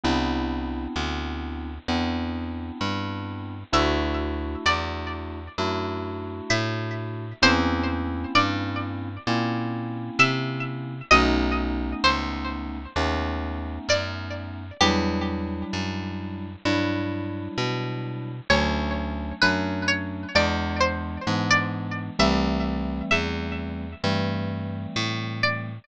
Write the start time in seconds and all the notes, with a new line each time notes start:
0.03 C2 B3 C4 D4 E4
0.96 D2
1.88 E2 B3 C4 D4 E4
2.81 G2
3.73 D2 A3 D4 E4 F#4 E5
4.66 E2 D5
5.58 F#2 A3 D4 E4 F#4
6.50 A2 E5
7.42 E2 A#3 C4 C#4 E4 C5
8.35 G2 D5
9.27 A#2 A#3 C4 C#4 E4
10.19 C3 E5
11.11 B1 A3 B3 C#4 D#4 D#5
12.04 C#2 C5
12.96 D#2 A3 B3 C#4 D#4
13.89 F#2 D5
14.81 E2 F#3 G3 D4 E4 G4
15.73 F#2
16.65 G2 F#3 G3 D4 E4
17.58 B2
18.50 D2 F#3 A3 C#4 D4 C#5
19.42 F#2 F#3 A3 C#4 D4 B4
19.88 C#5
20.35 E2 E3 G#3 B3 D4 D5
20.81 C5
21.27 G#2 E3 G#3 B3 D4
21.51 D5
22.19 C2 E3 G3 A3 C4 E5
23.11 E2 E5
24.03 G2 E3 G3 A3 C4
24.96 A2
25.43 D5